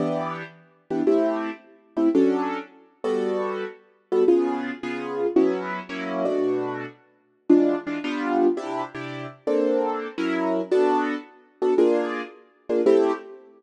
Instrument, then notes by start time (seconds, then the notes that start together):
acoustic grand piano
0.00 E3 B3 D4 G4
0.90 E3 B3 D4 G4
1.07 A3 C4 E4 G4
1.97 A3 C4 E4 G4
2.15 F#3 C#4 D4 A4
3.04 G3 B3 F#4 A4
4.12 G3 B3 F#4 A4
4.28 C#3 B3 F4 G#4
4.83 C#3 B3 F4 G#4
5.36 F#3 B3 C#4 E4
5.89 F#3 A#3 C#4 E4
6.25 B2 A3 D4 F#4
7.49 E3 G#3 D4 F4
7.87 E3 G#3 D4 F4
8.04 G3 B3 D4 F4
8.57 C3 D4 E4 G4
8.95 C3 D4 E4 G4
9.47 A#3 C4 D4 A4
10.18 F#3 C#4 E4 A#4
10.71 B3 D4 F#4 A4
11.62 B3 D4 F#4 A4
11.78 A#3 D4 F4 G#4
12.69 A#3 D4 F4 G#4
12.86 A3 C4 E4 G4